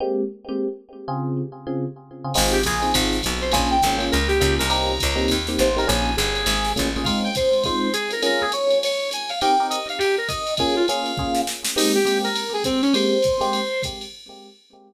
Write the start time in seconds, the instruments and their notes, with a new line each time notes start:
0.00 electric piano 1 G#3 A#3 C4 G4
0.49 electric piano 1 G#3 A#3 C4 G4
1.08 electric piano 1 C#3 C4 F4 G#4
1.67 electric piano 1 C#3 C4 F4 G#4
2.24 electric piano 1 C#3 C4 F4 G#4
2.34 electric bass (finger) G#1, electric piano 1 C4 D#4 F4 G#4, crash, ride
2.52 brass section G4
2.63 electric bass (finger) A#1, brass section G#4, kick, hi-hat pedal, ride
2.82 electric piano 1 C4 D#4 F4 G#4, ride
2.94 electric bass (finger) G#1, electric piano 1 C4 D#4 F4 G#4, kick, ride
3.13 snare
3.23 electric bass (finger) B1, kick, hi-hat pedal, ride
3.41 brass section C5, ride
3.52 electric bass (finger) A#1, electric piano 1 A#3 C#4 F4 G#4, brass section G#5, kick, ride
3.71 brass section G5
3.82 electric bass (finger) G#1, electric piano 1 A#3 C#4 F4 G#4, kick, hi-hat pedal, ride
3.98 electric piano 1 A#3 C#4 F4 G#4, ride
4.12 electric bass (finger) C#2, brass section A#4, ride
4.28 brass section G4, snare
4.40 electric bass (finger) C#2, electric piano 1 A#3 C#4 F4 G#4, kick, hi-hat pedal, ride
4.59 electric bass (finger) C2, brass section A#4, ride
4.70 electric piano 1 A#3 C4 D#4 G4, brass section A#5, ride
5.00 electric bass (finger) C#2, kick, hi-hat pedal, ride
5.16 electric piano 1 A#3 C4 D#4 G4, ride
5.28 electric bass (finger) D#2, kick, ride
5.47 electric piano 1 A#3 C4 D#4 G4, snare
5.59 electric bass (finger) A1, brass section C5, hi-hat pedal, ride
5.76 electric piano 1 A#3 C4 D#4 G4, brass section A#4, ride
5.87 electric bass (finger) A#1, electric piano 1 A#3 C#4 F4 G#4, brass section G#5, ride
6.17 electric bass (finger) G1, brass section G#4, hi-hat pedal, ride
6.35 ride
6.46 electric bass (finger) G#1, ride
6.65 snare
6.76 electric bass (finger) A1, electric piano 1 A#3 C#4 F4 G#4, kick, hi-hat pedal, ride
6.96 electric piano 1 A#3 C#4 F4 G#4, ride
7.04 electric piano 1 G#3 C4 D#4 F4, brass section F5, kick, ride
7.24 brass section G5
7.35 brass section C5, kick, hi-hat pedal, ride
7.53 ride
7.64 electric piano 1 G#3 C4 D#4 F4, brass section C5, kick, ride
7.93 brass section G#4, hi-hat pedal, ride
8.11 brass section A#4, ride
8.22 electric piano 1 A#3 C#4 F4 G#4, brass section A#4, ride
8.41 brass section G#4
8.52 brass section C#5, hi-hat pedal, ride
8.70 ride
8.83 brass section C#5, ride
9.11 brass section G#5, hi-hat pedal, ride
9.29 brass section F5, ride
9.41 electric piano 1 C4 D#4 G4 A#4, brass section G5, ride
9.60 electric piano 1 C4 D#4 G4 A#4
9.70 brass section D#5, hi-hat pedal, ride
9.89 brass section F5, ride
9.98 brass section G4, ride
10.18 brass section A#4
10.28 brass section D#5, kick, hi-hat pedal, ride
10.47 ride
10.57 electric piano 1 A#3 C#4 F4 G#4, brass section G#4, kick, ride
10.76 brass section F4
10.88 electric piano 1 A#3 C#4 F4 G#4, brass section F5, hi-hat pedal, ride
11.06 ride
11.17 electric piano 1 A#3 C#4 F4 G#4, kick
11.35 snare
11.47 snare
11.65 snare
11.76 electric piano 1 G#3 A#3 C4 G4, brass section D#4, crash, ride
11.95 brass section G4
12.05 electric piano 1 G#3 A#3 C4 G4, hi-hat pedal, ride
12.24 brass section A#4, ride
12.36 ride
12.54 brass section G#4
12.64 brass section C4, kick, hi-hat pedal, ride
12.82 brass section C#4, ride
12.94 electric piano 1 G#3 A#3 C4 G4, brass section C5, ride
13.22 kick, hi-hat pedal, ride
13.41 electric piano 1 G#3 A#3 C4 G4, ride
13.53 ride
13.83 kick, hi-hat pedal, ride
14.01 ride